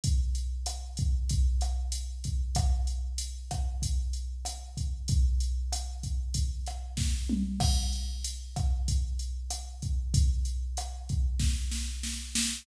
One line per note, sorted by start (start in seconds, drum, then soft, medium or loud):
0.04 kick medium
0.04 closed hi-hat medium
0.35 closed hi-hat medium
0.66 cross-stick medium
0.66 closed hi-hat medium
0.97 kick medium
0.97 closed hi-hat medium
1.29 kick medium
1.29 closed hi-hat medium
1.61 cross-stick medium
1.61 closed hi-hat medium
1.92 closed hi-hat medium
2.24 kick medium
2.24 closed hi-hat medium
2.55 kick medium
2.55 cross-stick medium
2.55 closed hi-hat medium
2.87 closed hi-hat medium
3.18 closed hi-hat medium
3.51 kick medium
3.51 cross-stick medium
3.51 closed hi-hat medium
3.82 kick medium
3.82 closed hi-hat medium
4.13 closed hi-hat medium
4.45 cross-stick medium
4.45 closed hi-hat medium
4.77 kick medium
4.77 closed hi-hat medium
5.08 kick medium
5.08 closed hi-hat medium
5.40 closed hi-hat medium
5.73 cross-stick medium
5.73 closed hi-hat medium
6.03 kick medium
6.03 closed hi-hat medium
6.34 kick medium
6.34 closed hi-hat medium
6.66 cross-stick medium
6.66 closed hi-hat medium
6.97 kick medium
6.97 snare medium
7.29 mid tom medium
7.60 kick medium
7.60 cross-stick medium
7.60 crash medium
7.93 closed hi-hat medium
8.24 closed hi-hat medium
8.56 kick medium
8.56 cross-stick medium
8.56 closed hi-hat medium
8.88 kick medium
8.88 closed hi-hat medium
9.19 closed hi-hat medium
9.51 cross-stick medium
9.51 closed hi-hat medium
9.82 kick medium
9.82 closed hi-hat medium
10.14 kick medium
10.14 closed hi-hat medium
10.45 closed hi-hat medium
10.77 cross-stick medium
10.77 closed hi-hat medium
11.09 kick medium
11.09 closed hi-hat medium
11.39 kick medium
11.39 snare medium
11.71 snare medium
12.03 snare medium
12.35 snare medium